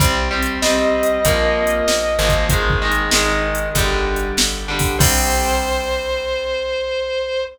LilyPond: <<
  \new Staff \with { instrumentName = "Distortion Guitar" } { \time 4/4 \key c \minor \tempo 4 = 96 r4 ees''2. | r1 | c''1 | }
  \new Staff \with { instrumentName = "Overdriven Guitar" } { \time 4/4 \key c \minor <g c'>8 <g c'>8 <g c'>4 <f bes>4. <f bes>8 | <ees aes>8 <ees aes>8 <ees aes>4 <d g>4. <d g>8 | <g c'>1 | }
  \new Staff \with { instrumentName = "Electric Bass (finger)" } { \clef bass \time 4/4 \key c \minor c,4 c,4 bes,,4 bes,,8 aes,,8~ | aes,,4 aes,,4 g,,4 g,,4 | c,1 | }
  \new DrumStaff \with { instrumentName = "Drums" } \drummode { \time 4/4 \tuplet 3/2 { <hh bd>8 r8 hh8 sn8 r8 hh8 <hh bd>8 r8 hh8 sn8 r8 <hh bd>8 } | \tuplet 3/2 { <hh bd>8 bd8 hh8 sn8 r8 hh8 <hh bd>8 r8 hh8 sn8 r8 <bd hho>8 } | <cymc bd>4 r4 r4 r4 | }
>>